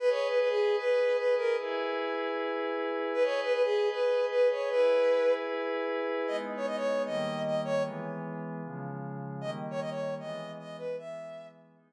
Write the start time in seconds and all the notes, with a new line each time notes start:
0.00 G#4 B4 D#5
0.10 C#5
0.29 B4
0.39 B4
0.49 G#4
0.79 B4
1.18 B4
1.37 A#4
1.58 E4 G#4 B4
3.14 G#4 B4 D#5
3.24 C#5
3.43 B4
3.53 B4
3.63 G#4
3.92 B4
4.31 B4
4.51 C#5
4.70 E4 G#4 B4
6.27 G#3 B3 D#4 D#5
6.57 C#5
6.67 D#5
6.76 C#5
7.05 D#3 G3 A#3 D#5
7.45 D#5
7.65 C#5
7.83 E3 G#3 B3
8.64 C#3 F3 G#3
9.41 D#3 G3 A#3 D#5
9.71 C#5
9.80 D#5
9.90 C#5
10.20 E3 G#3 B3 D#5
10.59 D#5
10.78 B4
10.98 E3 G#3 B3 E5
11.75 G#3 B3 D#4